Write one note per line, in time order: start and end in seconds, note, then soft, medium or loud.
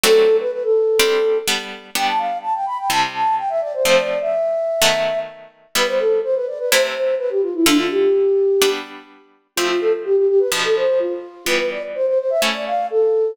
0.04 0.89 F#3 loud
0.04 0.89 A3 loud
0.04 0.89 C4 loud
0.04 0.89 D4 loud
0.04 0.36 A4 loud
0.40 0.51 B4 loud
0.52 0.63 B4 medium
0.63 1.38 A4 medium
1.00 1.42 G3 loud
1.00 1.42 C4 loud
1.00 1.42 D4 loud
1.48 1.90 G3 loud
1.48 1.90 B3 loud
1.48 1.90 D4 medium
1.95 2.81 G3 loud
1.95 2.81 B3 medium
1.95 2.81 D4 loud
1.95 2.07 G5 loud
2.07 2.19 A5 medium
2.18 2.38 F5 medium
2.42 2.53 A5 medium
2.54 2.66 G5 medium
2.66 2.77 B5 medium
2.78 2.89 G5 medium
2.90 3.76 C3 loud
2.90 3.76 G3 medium
2.90 3.76 E4 medium
2.90 3.01 A5 medium
3.14 3.35 A5 medium
3.38 3.49 G5 medium
3.49 3.61 E5 medium
3.61 3.73 D5 loud
3.74 3.84 C5 medium
3.85 4.71 F3 loud
3.85 4.71 A3 loud
3.85 4.71 C4 loud
3.85 3.96 C5 loud
3.97 4.19 D5 medium
4.21 5.19 E5 medium
4.82 5.67 D#3 loud
4.82 5.67 F#3 loud
4.82 5.67 A3 loud
4.82 5.67 B3 medium
5.75 6.61 G3 loud
5.75 6.61 B3 loud
5.75 6.61 E4 loud
5.75 5.87 B4 loud
5.88 5.99 C5 medium
5.99 6.20 A4 medium
6.23 6.35 C5 medium
6.35 6.47 B4 medium
6.47 6.58 D5 medium
6.59 6.70 B4 medium
6.71 7.58 C3 loud
6.71 7.58 A3 medium
6.71 7.58 E4 loud
6.71 6.82 C5 medium
6.95 7.15 C5 medium
7.19 7.30 B4 loud
7.30 7.41 G4 medium
7.42 7.54 F4 medium
7.54 7.66 E4 medium
7.66 8.52 D3 loud
7.66 8.52 A3 medium
7.66 7.78 D4 loud
7.66 8.52 F4 medium
7.78 7.90 F4 medium
7.90 8.69 G4 medium
8.62 9.47 G3 medium
8.62 9.47 B3 loud
8.62 9.47 D4 loud
9.56 10.43 F3 loud
9.56 10.43 A3 medium
9.56 10.43 C4 loud
9.56 9.68 F4 loud
9.69 9.80 F4 medium
9.81 9.92 A4 medium
10.05 10.16 G4 loud
10.17 10.28 G4 medium
10.28 10.40 G4 loud
10.39 10.51 B4 medium
10.52 11.37 B2 loud
10.52 11.37 F3 loud
10.52 11.37 D4 medium
10.64 10.75 A4 medium
10.76 10.99 C5 medium
10.99 11.45 F4 medium
11.46 12.32 E3 medium
11.46 12.32 G3 loud
11.46 12.32 B3 loud
11.46 11.58 B4 loud
11.59 11.70 B4 medium
11.71 11.82 D5 medium
11.95 12.06 C5 medium
12.07 12.18 C5 medium
12.19 12.30 C5 medium
12.30 12.41 E5 loud
12.42 13.28 A3 loud
12.42 13.28 C#4 medium
12.42 13.28 E4 medium
12.54 12.65 D5 medium
12.67 12.86 F5 medium
12.90 13.31 A4 medium